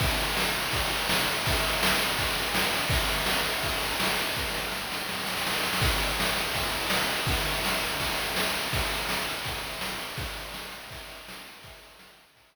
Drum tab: CC |----------------|----------------|----------------|----------------|
RD |x-x---x-x-x---x-|x-x---x-x-x---x-|x-x---x-x-x---x-|----------------|
SD |----o-------o---|----o-------o---|----o-------o---|o-o-o-o-oooooooo|
BD |o-------o-------|o-------o-------|o-------o-------|o---------------|

CC |x---------------|----------------|----------------|----------------|
RD |--x---x-x-x---x-|x-x---x-x-x---x-|x-x---x-x-x---x-|x-x---x-x-x---x-|
SD |----o-------o---|----o-------o---|----o-------o---|----o-------o---|
BD |o-------o-------|o-------o-------|o-------o-------|o-------o-------|

CC |----------------|
RD |x-x---x-x-------|
SD |----o-----------|
BD |o-------o-------|